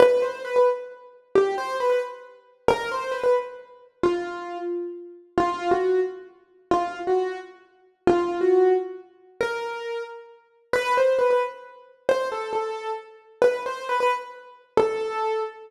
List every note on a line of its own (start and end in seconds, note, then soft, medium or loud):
0.00 0.21 B4 medium
0.22 0.40 C5 medium
0.45 0.55 B4 medium
0.56 0.67 B4 medium
1.35 1.55 G4 medium
1.58 1.76 C5 medium
1.80 1.89 B4 medium
1.90 2.00 B4 medium
2.68 2.89 A#4 loud
2.92 3.12 C5 medium
3.11 3.22 B4 medium
3.24 3.34 B4 medium
4.03 4.58 F4 medium
5.38 5.70 F4 medium
5.71 6.00 F#4 medium
6.71 6.99 F4 medium
7.07 7.37 F#4 medium
8.07 8.38 F4 medium
8.41 8.73 F#4 medium
9.41 10.02 A#4 medium
10.73 10.94 B4 medium
10.97 11.18 C5 medium
11.19 11.29 B4 medium
11.30 11.41 B4 medium
12.09 12.27 C5 medium
12.32 12.50 A4 medium
12.53 12.90 A4 medium
13.42 13.60 B4 medium
13.66 13.84 C5 medium
13.89 14.00 B4 medium
14.00 14.11 B4 medium
14.77 15.41 A4 medium